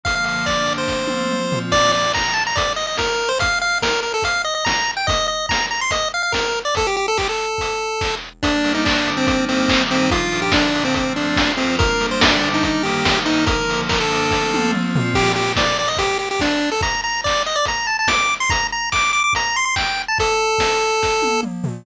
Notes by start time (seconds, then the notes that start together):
0.04 D3 F3 A#3 F5, kick, closed hi-hat
0.15 F5
0.24 F5, open hi-hat
0.46 D3 A#3 D4 D5, kick, clap
0.66 open hi-hat
0.78 C5
0.88 F3 A3 C4, kick, snare
1.07 high tom
1.31 F3 C4 F4, mid tom
1.52 floor tom
1.72 D5, kick, crash
1.92 D5
2.14 A#5, kick, clap
2.34 A5
2.47 A#5
2.56 D5, kick, closed hi-hat
2.76 D#5
2.87 D#5
2.97 A#4, kick, snare
3.29 C5
3.39 F5, kick, closed hi-hat
3.62 F5
3.82 A#4, kick, snare
4.03 A#4
4.14 A4
4.22 F5, kick, closed hi-hat
4.45 D#5
4.55 D#5
4.65 A#5, kick, snare
4.97 G5
5.07 D#5, kick, closed hi-hat
5.28 D#5
5.49 A#5, kick, snare
5.71 A#5
5.81 C6
5.91 D#5, kick, closed hi-hat
6.14 F5
6.23 F5
6.32 A#4, kick, snare
6.65 D5
6.75 A4, kick, closed hi-hat
6.87 G4
6.97 G4
7.08 A4
7.18 G4, kick, clap
7.29 A4
7.58 kick, closed hi-hat
8.01 kick, clap
8.43 G3 A#3 D4, kick, closed hi-hat
8.64 open hi-hat
8.75 D#4
8.85 D3 G3 D4, kick, clap
9.07 open hi-hat
9.17 C4
9.27 G3 A#3 C4 D#4, kick, closed hi-hat
9.49 C4, open hi-hat
9.69 D#3 G3 D#4, kick, clap
9.91 C4, open hi-hat
10.11 A#2 F3 D4 F4, kick, closed hi-hat
10.32 open hi-hat
10.42 G4
10.52 A#2 D3 D4, kick, snare
10.75 open hi-hat
10.85 C4
10.94 F3 A3 C4, kick, closed hi-hat
11.16 D4, open hi-hat
11.36 F3 C4 F4, kick, snare
11.57 C4, open hi-hat
11.79 G3 A#3 D4 A#4, kick, closed hi-hat
12.00 open hi-hat
12.11 C5
12.21 D3 G3 D4, kick, snare
12.44 open hi-hat
12.54 D#4
12.63 D#3 G3 A#3 D#4, kick, closed hi-hat
12.83 G4, open hi-hat
13.05 D#3 A#3 D#4, kick, snare
13.25 D#4, open hi-hat
13.46 D3 F3 A#3 A#4, kick, closed hi-hat
13.70 open hi-hat
13.89 D3 A#3 D4 A#4, kick, clap
14.00 A4
14.11 open hi-hat
14.31 F3 A3 C4, kick, snare
14.54 high tom
14.72 F3 C4 F4, mid tom
14.96 floor tom
15.14 G4, kick, crash
15.36 G4
15.56 D5, kick, snare
15.79 D5
15.88 D#5
15.97 G4, kick, closed hi-hat
16.19 G4
16.31 G4
16.40 D4, kick, snare
16.72 A4
16.81 A#5, kick, closed hi-hat
17.04 A#5
17.24 D5, kick, clap
17.46 D#5
17.56 D5
17.65 A#5, kick, closed hi-hat
17.87 A5
17.99 A5
18.08 D6, kick, snare
18.40 C6
18.50 A#5, kick, closed hi-hat
18.72 A#5
18.92 D6, kick, clap
19.13 D6
19.24 D6
19.33 A#5, kick, closed hi-hat
19.56 C6
19.65 C6
19.76 G5, kick, clap
20.08 A5
20.18 A4, kick, closed hi-hat
20.58 kick, snare
21.03 kick, snare
21.22 high tom
21.43 mid tom
21.64 floor tom